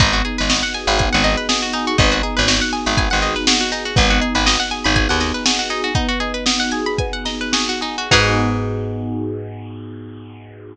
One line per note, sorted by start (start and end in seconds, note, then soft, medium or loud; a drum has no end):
0.00 0.22 G#1 medium
0.00 0.97 B3 medium
0.00 0.12 D#4 medium
0.00 kick loud
0.00 closed hi-hat loud
0.13 0.23 F#4 medium
0.13 closed hi-hat medium
0.25 1.23 D#4 medium
0.25 0.37 G#4 medium
0.25 closed hi-hat medium
0.38 0.63 G#1 medium
0.38 0.49 B4 medium
0.38 closed hi-hat medium
0.49 1.49 F#4 medium
0.49 0.62 D#5 medium
0.49 snare loud
0.63 0.73 F#5 medium
0.63 closed hi-hat medium
0.74 1.74 G#4 medium
0.74 0.86 G#5 medium
0.74 closed hi-hat medium
0.87 1.09 G#1 medium
0.87 0.98 B5 medium
0.87 closed hi-hat medium
0.98 1.93 B3 medium
0.98 1.11 G#5 medium
0.98 kick loud
0.98 closed hi-hat loud
1.13 1.36 G#1 medium
1.13 1.23 F#5 medium
1.13 closed hi-hat medium
1.24 1.95 D#4 medium
1.24 1.36 D#5 medium
1.24 snare medium
1.24 closed hi-hat loud
1.37 1.48 B4 medium
1.37 closed hi-hat medium
1.49 1.97 F#4 medium
1.49 1.61 G#4 medium
1.49 snare loud
1.62 1.73 F#4 medium
1.62 closed hi-hat medium
1.73 1.86 D#4 medium
1.73 1.98 G#4 medium
1.73 closed hi-hat loud
1.87 1.97 F#4 medium
1.87 closed hi-hat medium
1.98 2.22 G#1 medium
1.98 2.97 B3 loud
1.98 2.10 D#4 medium
1.98 kick loud
1.98 closed hi-hat loud
2.12 2.22 F#4 medium
2.12 closed hi-hat medium
2.22 3.22 D#4 medium
2.22 2.35 G#4 medium
2.22 closed hi-hat medium
2.37 2.61 G#1 medium
2.37 2.47 B4 medium
2.37 snare soft
2.37 closed hi-hat medium
2.48 3.47 F#4 medium
2.48 2.60 D#5 medium
2.48 snare loud
2.61 2.72 F#5 medium
2.61 closed hi-hat medium
2.73 3.71 G#4 medium
2.73 2.85 G#5 medium
2.73 closed hi-hat medium
2.86 3.09 G#1 medium
2.86 2.96 B5 medium
2.86 snare soft
2.86 closed hi-hat medium
2.97 3.92 B3 medium
2.97 3.10 G#5 medium
2.97 kick loud
2.97 closed hi-hat loud
3.10 3.35 G#1 medium
3.10 3.21 F#5 medium
3.10 closed hi-hat medium
3.22 3.93 D#4 medium
3.22 3.34 D#5 medium
3.22 snare medium
3.22 closed hi-hat medium
3.35 3.46 B4 medium
3.35 snare soft
3.35 closed hi-hat medium
3.47 3.95 F#4 medium
3.47 3.59 G#4 medium
3.47 snare loud
3.60 3.71 F#4 medium
3.60 closed hi-hat medium
3.72 3.84 D#4 medium
3.72 3.95 G#4 medium
3.72 closed hi-hat medium
3.85 3.96 F#4 medium
3.85 closed hi-hat medium
3.96 4.20 G#1 medium
3.96 4.94 B3 medium
3.96 4.09 D#4 medium
3.96 kick loud
3.96 closed hi-hat loud
4.10 4.20 F#4 medium
4.10 closed hi-hat medium
4.21 5.20 D#4 medium
4.21 4.34 G#4 medium
4.21 closed hi-hat medium
4.35 4.57 G#1 medium
4.35 4.45 B4 medium
4.35 closed hi-hat medium
4.46 5.45 F#4 medium
4.46 4.58 D#5 medium
4.46 snare loud
4.59 4.70 F#5 medium
4.59 closed hi-hat medium
4.71 5.69 G#4 medium
4.71 4.83 G#5 medium
4.71 closed hi-hat medium
4.84 5.08 G#1 medium
4.84 4.95 B5 medium
4.84 closed hi-hat medium
4.95 5.89 B3 medium
4.95 5.08 G#5 medium
4.95 kick loud
4.95 closed hi-hat loud
5.09 5.32 D#2 medium
5.09 5.19 F#5 medium
5.09 closed hi-hat medium
5.20 5.91 D#4 medium
5.20 5.33 D#5 medium
5.20 snare medium
5.20 closed hi-hat medium
5.34 5.44 B4 medium
5.34 closed hi-hat medium
5.45 5.93 F#4 medium
5.45 5.58 G#4 medium
5.45 snare loud
5.59 5.69 F#4 medium
5.59 closed hi-hat medium
5.70 5.82 D#4 medium
5.70 5.93 G#4 medium
5.70 closed hi-hat medium
5.84 5.94 F#4 medium
5.84 closed hi-hat medium
5.95 6.99 B3 medium
5.95 6.07 D#4 medium
5.95 kick loud
5.95 closed hi-hat loud
6.09 6.19 F#4 medium
6.09 closed hi-hat medium
6.20 7.25 D#4 medium
6.20 6.33 G#4 medium
6.20 closed hi-hat medium
6.34 6.44 B4 medium
6.34 closed hi-hat medium
6.46 7.52 F#4 medium
6.46 6.58 D#5 medium
6.46 snare loud
6.60 6.71 F#5 medium
6.60 closed hi-hat medium
6.71 7.80 G#4 medium
6.71 6.85 G#5 medium
6.71 closed hi-hat medium
6.86 6.97 B5 medium
6.86 closed hi-hat medium
6.98 8.07 B3 medium
6.98 7.12 G#5 medium
6.98 kick loud
6.98 closed hi-hat loud
7.13 7.24 F#5 medium
7.13 closed hi-hat loud
7.25 8.07 D#4 medium
7.25 7.39 D#5 medium
7.25 snare medium
7.25 closed hi-hat medium
7.41 7.52 B4 medium
7.41 closed hi-hat medium
7.52 8.07 F#4 medium
7.52 7.68 G#4 medium
7.52 snare loud
7.69 7.81 F#4 medium
7.69 closed hi-hat medium
7.81 7.96 D#4 medium
7.81 8.09 G#4 medium
7.81 closed hi-hat medium
7.98 8.10 F#4 medium
7.98 closed hi-hat medium
8.11 10.75 G#2 loud
8.11 10.73 B3 loud
8.11 10.73 D#4 loud
8.11 10.74 D#4 medium
8.11 10.73 F#4 loud
8.11 10.74 F#4 loud
8.11 10.73 G#4 loud
8.11 10.74 G#4 loud
8.11 10.74 B4 medium
8.11 kick loud
8.11 crash loud